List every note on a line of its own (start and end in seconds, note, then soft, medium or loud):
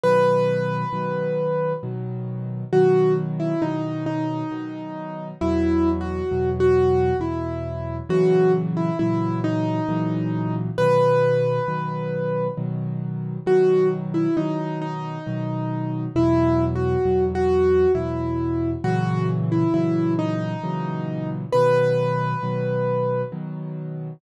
0.03 0.84 B2 medium
0.03 0.84 D#3 medium
0.03 0.84 F#3 medium
0.03 1.72 B4 loud
0.93 1.73 B2 medium
0.93 1.73 D#3 medium
0.93 1.73 F#3 medium
1.83 2.64 B2 medium
1.83 2.64 D#3 medium
1.83 2.64 F#3 medium
2.73 3.53 B2 medium
2.73 3.53 D#3 medium
2.73 3.53 F#3 medium
2.73 3.13 F#4 medium
3.40 3.61 E4 medium
3.62 4.43 B2 medium
3.62 4.43 D#3 medium
3.62 4.43 F#3 medium
3.62 4.04 D#4 medium
4.06 5.28 D#4 medium
4.51 5.32 B2 medium
4.51 5.32 D#3 medium
4.51 5.32 F#3 medium
5.41 6.22 E2 medium
5.41 6.22 B2 medium
5.41 6.22 F#3 medium
5.41 5.89 E4 loud
6.01 6.49 F#4 medium
6.31 7.12 E2 medium
6.31 7.12 B2 medium
6.31 7.12 F#3 medium
6.60 7.17 F#4 medium
7.20 8.00 E2 medium
7.20 8.00 B2 medium
7.20 8.00 F#3 medium
7.20 7.96 E4 medium
8.09 8.90 A#2 medium
8.09 8.90 C#3 medium
8.09 8.90 E3 medium
8.09 8.90 F#3 medium
8.09 8.52 F#4 loud
8.77 8.98 E4 medium
8.99 9.80 A#2 medium
8.99 9.80 C#3 medium
8.99 9.80 E3 medium
8.99 9.80 F#3 medium
8.99 9.39 E4 medium
9.44 10.55 D#4 loud
9.89 10.69 A#2 medium
9.89 10.69 C#3 medium
9.89 10.69 E3 medium
9.89 10.69 F#3 medium
10.78 11.59 B2 medium
10.78 11.59 D#3 medium
10.78 11.59 F#3 medium
10.78 12.47 B4 loud
11.68 12.49 B2 medium
11.68 12.49 D#3 medium
11.68 12.49 F#3 medium
12.57 13.38 B2 medium
12.57 13.38 D#3 medium
12.57 13.38 F#3 medium
13.46 14.27 B2 medium
13.46 14.27 D#3 medium
13.46 14.27 F#3 medium
13.46 13.87 F#4 medium
14.14 14.35 E4 medium
14.37 15.18 B2 medium
14.37 15.18 D#3 medium
14.37 15.18 F#3 medium
14.37 14.79 D#4 medium
14.82 16.04 D#4 medium
15.26 16.07 B2 medium
15.26 16.07 D#3 medium
15.26 16.07 F#3 medium
16.15 16.96 E2 medium
16.15 16.96 B2 medium
16.15 16.96 F#3 medium
16.15 16.64 E4 loud
16.75 17.24 F#4 medium
17.05 17.86 E2 medium
17.05 17.86 B2 medium
17.05 17.86 F#3 medium
17.35 17.92 F#4 medium
17.95 18.75 E2 medium
17.95 18.75 B2 medium
17.95 18.75 F#3 medium
17.95 18.70 E4 medium
18.84 19.65 A#2 medium
18.84 19.65 C#3 medium
18.84 19.65 E3 medium
18.84 19.65 F#3 medium
18.84 19.26 F#4 loud
19.52 19.73 E4 medium
19.74 20.55 A#2 medium
19.74 20.55 C#3 medium
19.74 20.55 E3 medium
19.74 20.55 F#3 medium
19.74 20.13 E4 medium
20.19 21.29 D#4 loud
20.63 21.44 A#2 medium
20.63 21.44 C#3 medium
20.63 21.44 E3 medium
20.63 21.44 F#3 medium
21.52 22.34 B2 medium
21.52 22.34 D#3 medium
21.52 22.34 F#3 medium
21.52 23.21 B4 loud
22.43 23.23 B2 medium
22.43 23.23 D#3 medium
22.43 23.23 F#3 medium
23.32 24.12 B2 medium
23.32 24.12 D#3 medium
23.32 24.12 F#3 medium